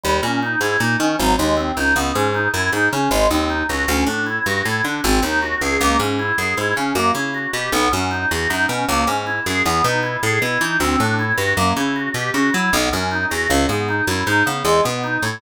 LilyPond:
<<
  \new Staff \with { instrumentName = "Drawbar Organ" } { \time 5/4 \key cis \minor \tempo 4 = 156 g8 cis'8 dis'8 e'8 dis'8 cis'8 fis8 gis8 bis8 dis'8 | b8 cis'8 dis'8 e'8 dis'8 cis'8 gis8 bis8 dis'8 fis'8 | cis'8 d'8 e'8 fis'8 e'8 d'8 bis8 dis'8 fis'8 gis'8 | ais8 cis'8 e'8 gis'8 e'8 cis'8 ais8 e'8 fis'8 g'8 |
b8 cis'8 dis'8 fis'8 dis'8 cis'8 ais8 cis'8 e'8 gis'8 | b8 dis'8 e'8 gis'8 e'8 dis'8 c'8 d'8 e'8 fis'8 | ais8 e'8 fis'8 g'8 fis'8 e'8 b8 cis'8 dis'8 fis'8 | cis8 b8 dis'8 e'8 dis'8 b8 gis8 b8 dis'8 e'8 | }
  \new Staff \with { instrumentName = "Electric Bass (finger)" } { \clef bass \time 5/4 \key cis \minor dis,8 ais,4 gis,8 ais,8 dis8 gis,,8 dis,4 cis,8 | cis,8 gis,4 fis,8 gis,8 cis8 gis,,8 dis,4 cis,8 | d,8 a,4 g,8 a,8 d8 gis,,8 dis,4 cis,8 | cis,8 gis,4 fis,8 gis,8 cis8 fis,8 cis4 b,8 |
b,,8 fis,4 e,8 fis,8 b,8 cis,8 gis,4 fis,8 | e,8 b,4 a,8 b,8 e8 d,8 a,4 g,8 | fis,8 cis4 b,8 cis8 fis8 b,,8 fis,4 e,8 | cis,8 gis,4 fis,8 gis,8 cis8 e,8 b,4 a,8 | }
>>